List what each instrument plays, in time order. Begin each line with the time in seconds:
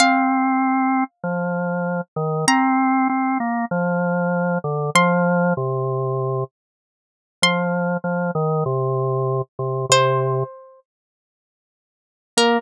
0.00 drawbar organ C4, pizzicato strings F5
1.24 drawbar organ F3
2.16 drawbar organ D#3
2.48 drawbar organ C4, pizzicato strings A#5
3.09 drawbar organ C4
3.40 drawbar organ A#3
3.71 drawbar organ F3
4.64 drawbar organ D3
4.95 drawbar organ F3, pizzicato strings C6
5.57 drawbar organ C3
7.42 drawbar organ F3, pizzicato strings C6
8.04 drawbar organ F3
8.35 drawbar organ D#3
8.66 drawbar organ C3
9.59 drawbar organ C3
9.89 drawbar organ C3, pizzicato strings C5
12.37 drawbar organ A#3, pizzicato strings A#4